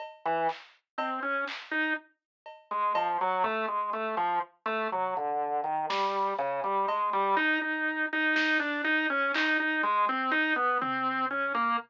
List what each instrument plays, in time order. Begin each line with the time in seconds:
0.00 cowbell
0.25 drawbar organ E3
0.49 clap
0.98 drawbar organ C4, cowbell
1.23 drawbar organ C#4
1.48 clap
1.71 drawbar organ D#4
2.46 cowbell
2.71 drawbar organ G#3
2.95 drawbar organ F3, cowbell
3.21 drawbar organ F#3
3.44 drawbar organ A3, kick
3.68 drawbar organ G#3
3.93 drawbar organ A3
4.17 drawbar organ F3
4.66 drawbar organ A3
4.92 drawbar organ F#3, floor tom
5.17 drawbar organ D3
5.64 drawbar organ D#3
5.90 drawbar organ G3, snare
6.39 drawbar organ C#3
6.64 drawbar organ G3
6.88 drawbar organ G#3, cowbell
7.13 drawbar organ G3
7.37 drawbar organ D#4, cowbell
7.61 drawbar organ D#4
8.13 drawbar organ D#4
8.36 drawbar organ D#4, snare
8.60 drawbar organ D4
8.84 drawbar organ D#4
9.10 drawbar organ C#4
9.34 drawbar organ D#4, clap
9.60 drawbar organ D#4
9.83 drawbar organ G#3
10.09 drawbar organ C4
10.31 drawbar organ D#4
10.56 drawbar organ B3
10.81 drawbar organ C4, floor tom
11.31 drawbar organ C#4
11.55 drawbar organ A#3